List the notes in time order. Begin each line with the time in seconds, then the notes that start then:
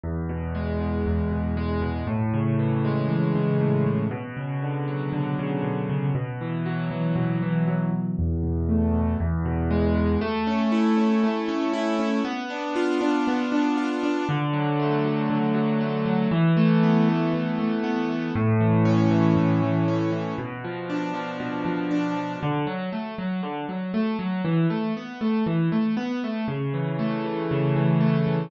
0.03 E2
0.29 B2
0.55 G#3
0.80 B2
1.06 E2
1.31 B2
1.57 G#3
1.82 B2
2.07 A2
2.34 C#3
2.59 E3
2.85 G#3
3.10 E3
3.35 C#3
3.60 A2
3.86 C#3
4.11 B2
4.37 C#3
4.62 D3
4.88 F#3
5.13 D3
5.39 C#3
5.63 B2
5.89 C#3
6.15 B2
6.41 E3
6.66 F#3
6.91 E3
7.16 B2
7.42 E3
7.67 F#3
7.93 E3
8.19 E2
8.43 B2
8.69 A3
8.94 B2
9.20 E2
9.45 B2
9.71 G#3
9.95 B2
10.21 A3
10.47 C#4
10.72 E4
10.97 C#4
11.23 A3
11.48 C#4
11.73 E4
11.99 C#4
12.25 B3
12.50 D4
12.76 F4
13.01 D4
13.27 B3
13.52 D4
13.77 F4
14.03 D4
14.29 D3
14.53 F#3
14.80 A3
15.05 F#3
15.30 D3
15.54 F#3
15.81 A3
16.06 F#3
16.31 E3
16.57 A3
16.83 B3
17.09 A3
17.33 E3
17.59 A3
17.84 B3
18.09 A3
18.35 A2
18.60 E3
18.85 C#4
19.11 E3
19.36 A2
19.63 E3
19.88 C#4
20.12 E3
20.38 B2
20.64 F3
20.90 D4
21.14 F3
21.40 B2
21.65 F3
21.91 D4
22.16 F3
22.43 D3
22.67 F#3
22.92 A3
23.18 F#3
23.43 D3
23.69 F#3
23.94 A3
24.19 F#3
24.45 E3
24.70 A3
24.97 B3
25.21 A3
25.46 E3
25.72 A3
25.97 B3
26.24 A3
26.48 C#3
26.74 E3
26.99 A3
27.24 E3
27.51 C#3
27.76 E3
28.01 A3
28.27 E3